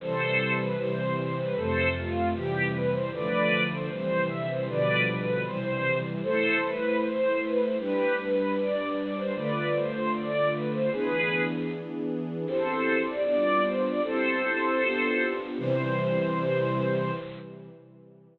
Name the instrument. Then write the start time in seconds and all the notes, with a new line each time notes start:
string ensemble 1
0.00 C3 E3 G3 A4 C5
0.58 B4
0.77 C3 E3 G3 C5
1.16 C5
1.37 B4
1.55 F2 C3 A3 A4 C5
1.94 F4
2.33 C3 E3 G3 G4
2.72 B4
2.92 C5
3.12 D3 F3 A3 B4 D5
3.70 C5
3.90 C3 E3 G3 C5
4.29 E5
4.48 C5
4.67 B2 D3 F3 G3 B4 D5
5.06 B4
5.45 C3 E3 G3 C5
6.23 A3 E4 A4 C5
6.63 B4
7.01 C5
7.41 B4
7.61 C5
7.79 G3 D4 G4 B4
8.18 B4
8.57 D5
8.97 D5
9.16 C5
9.34 D3 A3 F4 B4 D5
9.74 C5
10.13 D5
10.52 B4
10.72 C5
10.91 E3 B3 D4 G#4 B4
12.45 C4 E4 G4 A4 C5
13.06 D5
13.24 G3 B3 D4 F4 D5
13.63 C5
13.84 D5
14.02 C4 E4 G4 A4 C5
14.81 B3 D4 F4 G4
15.58 C3 E3 G3 C5